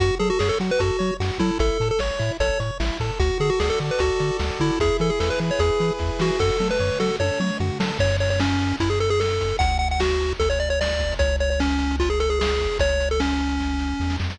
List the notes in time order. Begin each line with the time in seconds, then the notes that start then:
0.00 F#2 F#4, kick, closed hi-hat
0.19 F#3 G#4 A4, closed hi-hat
0.30 F#4
0.39 F#2 G#4 C#5, snare
0.49 A4
0.60 F#3 F#4, closed hi-hat
0.71 B4
0.79 F#2 F#4 A4, kick, closed hi-hat
0.99 F#3 C#5, closed hi-hat
1.20 F#2 F#4, snare
1.38 F#3 E4 A4, kick, open hi-hat
1.59 A1 E4 A4, kick, closed hi-hat
1.80 A2 A4, closed hi-hat
1.91 A4
1.99 A1 C#5, snare
2.19 A2 E4, closed hi-hat
2.40 A1 A4 C#5, kick, closed hi-hat
2.60 A2 C#5, closed hi-hat
2.80 A1 E4, snare
3.00 A2 A4, kick, open hi-hat
3.19 D2 F#4, kick, closed hi-hat
3.40 D3 G#4 A4, closed hi-hat
3.50 F#4
3.60 D2 G#4 D5, snare
3.70 A4
3.80 D3 F#4, closed hi-hat
3.91 B4
3.99 D2 F#4 A4, kick, closed hi-hat
4.19 D3 D5, closed hi-hat
4.39 D2 F#4, snare
4.59 D3 E4 A4, kick, open hi-hat
4.80 E2 E4 G#4, kick, closed hi-hat
4.99 E3 G#4 A4, closed hi-hat
5.10 G#4
5.20 E2 A4 B4, snare
5.30 B4
5.40 E3 E4, closed hi-hat
5.51 C#5
5.59 E2 G#4, kick, closed hi-hat
5.80 E3 B4, closed hi-hat
5.99 E2 E4, kick, snare
6.19 E3 F#4 G#4, snare
6.39 F#2 F#4 A4, kick, crash
6.60 F#3 A4, mid tom
6.71 B4
6.79 F#2 C#5, floor tom
7.00 F#3 F#4 A4, snare
7.19 F#2 A4 C#5, high tom
7.40 F#3 C#5, mid tom
7.60 F#2 F#4, floor tom
7.80 F#3 A4, snare
7.99 F#2 C#5, kick, crash
8.10 closed hi-hat
8.20 C#5, closed hi-hat
8.30 C#5, closed hi-hat
8.40 C#4, snare
8.51 closed hi-hat
8.60 closed hi-hat
8.68 closed hi-hat
8.80 F#2 E4, kick, closed hi-hat
8.90 G#4, closed hi-hat
9.00 A4, closed hi-hat
9.09 G#4, closed hi-hat
9.20 A4, snare
9.29 closed hi-hat
9.39 kick, closed hi-hat
9.48 closed hi-hat
9.59 D2 F#5, kick, closed hi-hat
9.69 closed hi-hat
9.79 F#5, closed hi-hat
9.91 F#5, closed hi-hat
10.00 F#4, snare
10.09 closed hi-hat
10.21 closed hi-hat
10.29 closed hi-hat
10.40 D2 A4, kick, closed hi-hat
10.50 C#5, closed hi-hat
10.59 D5, closed hi-hat
10.70 C#5, closed hi-hat
10.81 D5, snare
10.90 closed hi-hat
10.99 kick, closed hi-hat
11.12 closed hi-hat
11.19 C#2 C#5, kick, closed hi-hat
11.29 closed hi-hat
11.40 C#5, closed hi-hat
11.50 C#5, closed hi-hat
11.60 C#4, snare
11.70 closed hi-hat
11.79 closed hi-hat
11.91 closed hi-hat
11.99 F4, kick, closed hi-hat
12.09 G#4, closed hi-hat
12.20 A4, closed hi-hat
12.30 G#4, closed hi-hat
12.40 G#4, snare
12.50 closed hi-hat
12.60 kick, closed hi-hat
12.72 open hi-hat
12.79 C#2 C#5, kick, closed hi-hat
12.89 closed hi-hat
13.00 closed hi-hat
13.11 A4, closed hi-hat
13.20 C#4, snare
13.30 closed hi-hat
13.38 closed hi-hat
13.49 closed hi-hat
13.60 kick, snare
13.79 snare
14.00 E2, snare
14.10 snare
14.20 F2, snare
14.30 snare